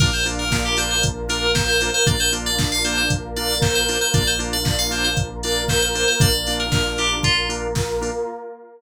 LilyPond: <<
  \new Staff \with { instrumentName = "Electric Piano 2" } { \time 4/4 \key bes \major \tempo 4 = 116 bes'16 c''16 r16 bes'8 g'16 c''16 c''16 r8 bes'8 c''16 c''8 c''16 | d''16 c''16 r16 d''8 f''16 c''16 c''16 r8 d''8 c''16 c''8 c''16 | d''16 c''16 r16 d''8 f''16 c''16 c''16 r8 d''8 c''16 c''8 c''16 | d''8. bes'8. g'8 f'8 r4. | }
  \new Staff \with { instrumentName = "Drawbar Organ" } { \time 4/4 \key bes \major <bes d' f'>8 <bes d' f'>4 <bes d' f'>4 <bes d' f'>4 <bes d' f'>8 | <bes d' f'>8 <bes d' f'>4 <bes d' f'>4 <bes d' f'>4 <bes d' f'>8 | <bes d' f'>8 <bes d' f'>4 <bes d' f'>4 <bes d' f'>4 <bes d' f'>8 | <bes d' f'>8 <bes d' f'>4 <bes d' f'>4 <bes d' f'>4 <bes d' f'>8 | }
  \new Staff \with { instrumentName = "Synth Bass 2" } { \clef bass \time 4/4 \key bes \major bes,,1 | bes,,1 | bes,,1 | bes,,1 | }
  \new Staff \with { instrumentName = "Pad 2 (warm)" } { \time 4/4 \key bes \major <bes d' f'>2 <bes f' bes'>2 | <bes d' f'>2 <bes f' bes'>2 | <bes d' f'>2 <bes f' bes'>2 | <bes d' f'>2 <bes f' bes'>2 | }
  \new DrumStaff \with { instrumentName = "Drums" } \drummode { \time 4/4 <cymc bd>8 hho8 <bd sn>8 hho8 <hh bd>8 hho8 <bd sn>8 hho8 | <hh bd>8 hho8 <bd sn>8 hho8 <hh bd>8 hho8 <bd sn>8 hho8 | <hh bd>8 hho8 <bd sn>8 hho8 <hh bd>8 hho8 <bd sn>8 hho8 | <hh bd>8 hho8 <bd sn>8 hho8 <hh bd>8 hho8 <bd sn>8 hho8 | }
>>